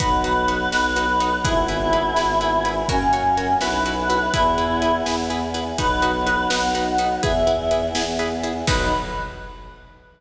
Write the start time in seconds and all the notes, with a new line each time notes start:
0.00 B1 B3 D#4 F#4 B4, kick, closed hi-hat
0.24 D#4 F#4 B4, closed hi-hat
0.48 D#4 F#4 B4, closed hi-hat
0.72 B1 D#4 F#4 B4, snare
0.96 D#4 F#4 B4, closed hi-hat
1.20 D#4 F#4 B4, closed hi-hat
1.44 G#1 B3 E4 G#4 B4, kick, closed hi-hat
1.68 E4 G#4 B4, closed hi-hat
1.93 E4 G#4 B4, closed hi-hat
2.16 G#1 E4 G#4 B4, snare
2.41 E4 G#4 B4, closed hi-hat
2.65 E4 G#4 B4, closed hi-hat
2.89 F#2 A#3 C#4 F#4 A#4 C#5, kick, closed hi-hat
3.13 F#4 A#4 C#5, closed hi-hat
3.37 F#4 A#4 C#5, closed hi-hat
3.61 B1 B3 E4 F#4 B4, snare
3.86 E4 F#4 B4, closed hi-hat
4.10 E4 F#4 B4, closed hi-hat
4.34 E2 B3 E4 G#4 B4, kick, closed hi-hat
4.58 E4 G#4 B4, closed hi-hat
4.82 E4 G#4 B4, closed hi-hat
5.06 E2 E4 G#4 B4, snare
5.30 E4 G#4 B4, closed hi-hat
5.54 E4 G#4 B4, closed hi-hat
5.78 B1 B3 D#4 F#4 B4, kick, closed hi-hat
6.02 D#4 F#4 B4, closed hi-hat
6.27 D#4 F#4 B4, closed hi-hat
6.50 B1 D#4 F#4 B4 F#5, snare
6.75 D#4 F#4 B4, closed hi-hat
6.98 D#4 F#4 B4, closed hi-hat
7.22 E2 B3 E4 G#4 B4 E5, kick, closed hi-hat
7.47 E4 G#4 B4, closed hi-hat
7.71 E4 G#4 B4, closed hi-hat
7.95 E2 E4 G#4 B4, snare
8.19 E4 G#4 B4, closed hi-hat
8.43 E4 G#4 B4, closed hi-hat
8.67 B1 B3 D#4 F#4 B4, kick, crash